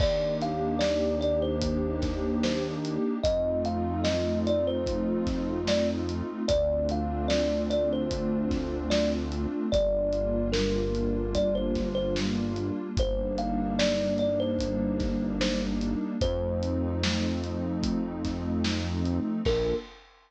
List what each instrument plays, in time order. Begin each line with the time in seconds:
0.00 synth bass 1 D#2, pad 2 (warm) A#3 D4 D#4 G4, kalimba D5, kick, crash
0.41 kalimba F5, snare, closed hi-hat
0.79 kalimba D5, snare
1.21 kalimba D5, closed hi-hat
1.42 kalimba C5
1.61 kick, closed hi-hat
2.02 kick, snare, closed hi-hat
2.43 kalimba C5, snare
2.85 closed hi-hat
3.23 synth bass 1 F2, pad 2 (warm) A3 C4 D#4 F4, kalimba D#5, kick, closed hi-hat
3.65 kalimba F5, closed hi-hat
4.04 kalimba D#5, snare
4.47 kalimba D5, closed hi-hat
4.67 kalimba C5
4.86 kick, closed hi-hat
5.27 kick, snare, closed hi-hat
5.67 kalimba D5, snare
6.09 closed hi-hat
6.48 synth bass 1 D2, pad 2 (warm) A3 C4 D4 F4, kalimba D5, kick, closed hi-hat
6.89 kalimba F5, closed hi-hat
7.28 kalimba D5, snare
7.70 kalimba D5, closed hi-hat
7.93 kalimba C5
8.11 kick, closed hi-hat
8.51 kick, snare, closed hi-hat
8.90 kalimba D5, snare
9.32 closed hi-hat
9.72 synth bass 1 G1, pad 2 (warm) G3 A#3 D4 F4, kalimba D5, kick, closed hi-hat
10.13 closed hi-hat
10.52 kalimba A#4, snare
10.95 closed hi-hat
11.35 kalimba D5, kick, closed hi-hat
11.55 kalimba C5
11.75 kick, snare, closed hi-hat
11.95 kalimba C5
12.16 snare
12.56 closed hi-hat
12.97 synth bass 1 G1, pad 2 (warm) G3 A#3 D4 D#4, kalimba C5, kick, closed hi-hat
13.38 kalimba F5, closed hi-hat
13.79 kalimba D5, snare
14.18 kalimba D5, closed hi-hat
14.40 kalimba C5
14.59 kick, closed hi-hat
15.00 kick, snare, closed hi-hat
15.41 kalimba C5, snare
15.81 closed hi-hat
16.21 synth bass 1 F2, pad 2 (warm) F3 A3 C4 D#4, kalimba C5, kick, closed hi-hat
16.63 closed hi-hat
17.03 snare
17.44 closed hi-hat
17.83 kick, closed hi-hat
18.25 kick, snare, closed hi-hat
18.64 snare
19.05 closed hi-hat
19.45 synth bass 1 A#1, pad 2 (warm) A#3 D4 F4 A4, kalimba A#4, kick, crash